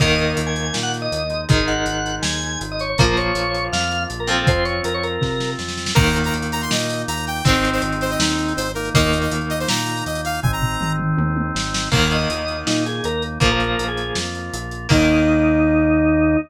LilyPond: <<
  \new Staff \with { instrumentName = "Drawbar Organ" } { \time 4/4 \key ees \major \tempo 4 = 161 ees''4 r16 aes''8 aes''16 r16 ges''16 r16 ees''4~ ees''16 | ees''8 ges''4. aes''4 r16 ees''16 des''16 des''16 | bes'8 des''4. f''4 r16 bes'16 a'16 a'16 | c''8 des''8 bes'16 des''16 bes'4. r4 |
r1 | r1 | r1 | r1 |
r8 ees''4. ees'8 aes'8 bes'8 r8 | bes'16 bes'4 aes'8. r2 | ees'1 | }
  \new Staff \with { instrumentName = "Lead 2 (sawtooth)" } { \time 4/4 \key ees \major r1 | r1 | r1 | r1 |
bes''8. bes''16 r8 bes''16 c'''16 ees''4 bes''8 g''8 | c''8. c''16 r8 c''16 ees''16 ees'4 c''8 bes'8 | ees''8. ees''16 r8 ees''16 c''16 bes''4 ees''8 f''8 | aes''16 bes''4~ bes''16 r2 r8 |
r1 | r1 | r1 | }
  \new Staff \with { instrumentName = "Overdriven Guitar" } { \time 4/4 \key ees \major <ees bes>1 | <ees aes>1 | <f bes>2.~ <f bes>8 <f c'>8~ | <f c'>1 |
<ees bes>1 | <ees aes c'>1 | <ees bes>1 | r1 |
<ees bes>1 | <f bes>1 | <ees bes>1 | }
  \new Staff \with { instrumentName = "Drawbar Organ" } { \time 4/4 \key ees \major <bes ees'>2.~ <bes ees'>8 <aes ees'>8~ | <aes ees'>1 | <bes f'>1 | <c' f'>1 |
<bes ees'>1 | <aes c' ees'>2.~ <aes c' ees'>8 <bes ees'>8~ | <bes ees'>1 | <aes c' ees'>1 |
<bes ees'>1 | <bes f'>1 | <bes ees'>1 | }
  \new Staff \with { instrumentName = "Synth Bass 1" } { \clef bass \time 4/4 \key ees \major ees,4 ees,4 bes,4 ees,4 | aes,,4 aes,,4 ees,4 aes,,4 | bes,,4 bes,,4 f,4 bes,,4 | f,4 f,4 c4 f,4 |
ees,4 ees,4 bes,4 ees,4 | aes,,4 aes,,4 ees,4 aes,,4 | ees,4 ees,4 bes,4 ees,4 | aes,,4 aes,,4 ees,4 aes,,4 |
ees,4 ees,4 bes,4 ees,4 | bes,,4 bes,,4 f,4 bes,,4 | ees,1 | }
  \new DrumStaff \with { instrumentName = "Drums" } \drummode { \time 4/4 <cymc bd>8 hh8 hh8 hh8 sn8 hh8 hh8 hh8 | <hh bd>8 hh8 hh8 hh8 sn8 hh8 hh8 hh8 | <hh bd>8 hh8 hh8 hh8 sn8 hh8 hh8 hh8 | <hh bd>8 hh8 hh8 hh8 <bd sn>8 sn8 sn16 sn16 sn16 sn16 |
<cymc bd>16 hh16 hh16 hh16 hh16 hh16 hh16 hh16 sn16 hh16 hh16 hh16 hh16 hh16 hh16 hh16 | <hh bd>16 hh16 hh16 hh16 hh16 hh16 hh16 hh16 sn16 hh16 hh16 hh16 hh16 hh16 hh16 hh16 | <hh bd>16 hh16 hh16 hh16 hh16 hh16 hh16 hh16 sn16 hh16 hh16 hh16 hh16 hh16 hh16 hh16 | <bd tomfh>8 tomfh8 toml8 toml8 tommh8 tommh8 sn8 sn8 |
<cymc bd>8 hh8 hh8 hh8 sn8 hh8 hh8 hh8 | <hh bd>8 hh8 hh8 hh8 sn8 hh8 hh8 hh8 | <cymc bd>4 r4 r4 r4 | }
>>